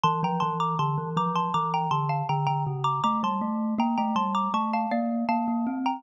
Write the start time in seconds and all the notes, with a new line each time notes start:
0.03 E3 A5 C6
0.23 F3 G5 A#5
0.40 E3 A5 C6
0.60 A#5 D6
0.79 D3 A5 C6
0.98 E3
1.17 F3 A#5 D6
1.35 A5 C6
1.54 E3 A#5 D6
1.74 G5 A#5
1.91 D3 A5 C6
2.09 F5 A5
2.29 D3 G5 A#5
2.47 D3 G5 A#5
2.67 C#3
2.84 A#5 D6
3.04 A3 A#5 D6
3.23 G3 A5 C6
3.41 A3
3.78 A#3 G5 A#5
3.98 A3 G5 A#5
4.16 G3 A5 C6
4.35 A#5 D6
4.54 A3 A5 C#6
4.73 F5 A5
4.91 A#3 D5 F5
5.29 A#3 F5 A5
5.48 A#3
5.67 C4
5.86 G5 A#5